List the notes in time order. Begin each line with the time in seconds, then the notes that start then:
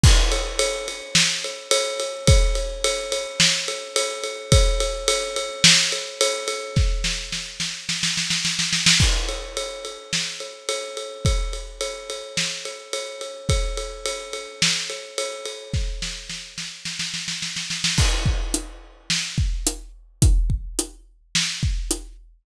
0.04 kick, crash
0.32 ride
0.59 ride
0.88 ride
1.15 snare
1.44 ride
1.71 ride
2.00 ride
2.27 kick, ride
2.55 ride
2.84 ride
3.12 ride
3.40 snare
3.68 ride
3.96 ride
4.23 ride
4.52 kick, ride
4.80 ride
5.08 ride
5.36 ride
5.64 snare
5.92 ride
6.21 ride
6.48 ride
6.76 kick, snare
7.04 snare
7.32 snare
7.60 snare
7.89 snare
8.03 snare
8.17 snare
8.30 snare
8.45 snare
8.59 snare
8.73 snare
8.86 snare
9.00 kick, crash
9.29 ride
9.57 ride
9.85 ride
10.13 snare
10.40 ride
10.69 ride
10.97 ride
11.25 kick, ride
11.53 ride
11.81 ride
12.10 ride
12.37 snare
12.65 ride
12.93 ride
13.21 ride
13.49 kick, ride
13.77 ride
14.05 ride
14.33 ride
14.62 snare
14.90 ride
15.18 ride
15.45 ride
15.73 kick, snare
16.02 snare
16.30 snare
16.58 snare
16.85 snare
16.99 snare
17.14 snare
17.28 snare
17.42 snare
17.56 snare
17.70 snare
17.84 snare
17.98 kick, crash
18.26 kick
18.54 closed hi-hat
19.10 snare
19.38 kick
19.67 closed hi-hat
20.22 kick, closed hi-hat
20.50 kick
20.79 closed hi-hat
21.35 snare
21.63 kick
21.91 closed hi-hat